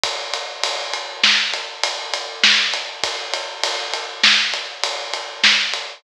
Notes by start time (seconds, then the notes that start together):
0.04 kick, ride
0.34 ride
0.64 ride
0.94 ride
1.24 snare
1.54 ride
1.83 ride
2.14 ride
2.44 snare
2.73 ride
3.04 kick, ride
3.33 ride
3.64 ride
3.94 ride
4.24 snare
4.54 ride
4.83 ride
5.13 ride
5.44 snare
5.74 ride